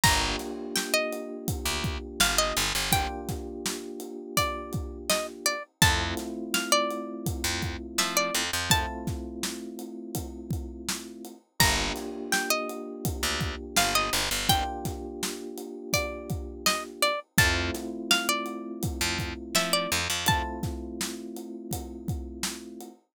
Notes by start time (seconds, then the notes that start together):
0.03 G1 A#3 D4 F4 G4 A#5, kick, crash
0.39 snare, closed hi-hat
0.76 G5, snare
0.94 D#5
1.13 closed hi-hat
1.48 kick, closed hi-hat
1.65 D2
1.84 kick, closed hi-hat
2.20 G1 F5, snare
2.38 D#5
2.56 G1, closed hi-hat
2.75 G1
2.92 A#3 D4 F4 G4 G5, kick, closed hi-hat
3.29 kick, snare, closed hi-hat
3.66 snare
4.00 closed hi-hat
4.37 D5, kick, closed hi-hat
4.73 kick, closed hi-hat
5.09 D#5, snare
5.46 D5, closed hi-hat
5.82 F2 A3 C4 E4 F4 A5, kick, closed hi-hat
6.17 snare, closed hi-hat
6.54 F5, snare
6.72 D5
6.91 closed hi-hat
7.26 kick, closed hi-hat
7.44 F2
7.62 kick, closed hi-hat
7.98 F3 E5, snare
8.17 D5
8.34 F2, closed hi-hat
8.53 F2
8.70 A3 C4 E4 F4 A5, kick, closed hi-hat
9.07 kick, snare, closed hi-hat
9.43 snare
9.79 closed hi-hat
10.15 kick, closed hi-hat
10.50 kick, closed hi-hat
10.89 snare
11.25 closed hi-hat
11.59 G1 A#3 D4 F4 G4 A#5, kick, crash
11.96 snare, closed hi-hat
12.32 G5, snare
12.50 D#5
12.69 closed hi-hat
13.05 kick, closed hi-hat
13.23 D2
13.41 kick, closed hi-hat
13.76 G1 F5, snare
13.95 D#5
14.13 G1, closed hi-hat
14.31 G1
14.49 A#3 D4 F4 G4 G5, kick, closed hi-hat
14.85 kick, snare, closed hi-hat
15.23 snare
15.58 closed hi-hat
15.93 D5, kick, closed hi-hat
16.30 kick, closed hi-hat
16.66 D#5, snare
17.02 D5, closed hi-hat
17.38 F2 A3 C4 E4 F4 A5, kick, closed hi-hat
17.74 snare, closed hi-hat
18.11 F5, snare
18.29 D5
18.46 closed hi-hat
18.83 kick, closed hi-hat
19.01 F2
19.19 kick, closed hi-hat
19.55 F3 E5, snare
19.73 D5
19.92 F2, closed hi-hat
20.10 F2
20.26 A3 C4 E4 F4 A5, kick, closed hi-hat
20.63 kick, snare, closed hi-hat
21.01 snare
21.36 closed hi-hat
21.71 kick, closed hi-hat
22.08 kick, closed hi-hat
22.43 snare
22.80 closed hi-hat